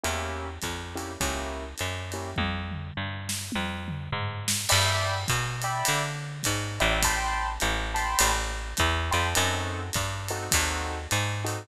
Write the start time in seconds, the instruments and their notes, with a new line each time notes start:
0.04 electric bass (finger) E2, acoustic grand piano A#3 C#4 E4 G4, ride
0.62 electric bass (finger) F2, kick, hi-hat pedal, ride
0.96 acoustic grand piano A#3 C#4 E4 G4, ride
1.20 electric bass (finger) C#2, acoustic grand piano A#3 C#4 E4 G4, kick, ride
1.78 electric bass (finger) F#2, hi-hat pedal, ride
2.12 acoustic grand piano A#3 C#4 E4 G4, ride
2.36 electric bass (finger) F2, kick, high tom
2.71 mid tom
2.97 electric bass (finger) G2
3.29 snare
3.52 electric bass (finger) F2, high tom
3.88 mid tom
4.12 electric bass (finger) G#2, floor tom
4.48 snare
4.69 electric bass (finger) G2, acoustic grand piano D5 E5 G5 B5, crash, ride
5.28 electric bass (finger) B2, kick, hi-hat pedal, ride
5.62 acoustic grand piano D5 E5 G5 B5, ride
5.85 electric bass (finger) D3, ride
6.43 electric bass (finger) G#2, kick, hi-hat pedal, ride
6.80 electric bass (finger) A1, acoustic grand piano D5 E5 G5 B5, ride
7.03 acoustic grand piano G5 A5 B5 C6, kick, ride
7.60 electric bass (finger) A1, hi-hat pedal, ride
7.94 acoustic grand piano G5 A5 B5 C6, ride
8.19 electric bass (finger) A1, ride
8.77 electric bass (finger) E2, kick, hi-hat pedal, ride
9.11 electric bass (finger) F2, acoustic grand piano G5 A5 B5 C6, ride
9.35 electric bass (finger) F#2, acoustic grand piano C4 D#4 F#4 A4, ride
9.93 electric bass (finger) G2, kick, hi-hat pedal, ride
10.28 acoustic grand piano C4 D#4 F#4 A4, ride
10.51 electric bass (finger) D#2, acoustic grand piano C4 D#4 F#4 A4, kick, ride
11.11 electric bass (finger) G#2, hi-hat pedal, ride
11.44 acoustic grand piano C4 D#4 F#4 A4, ride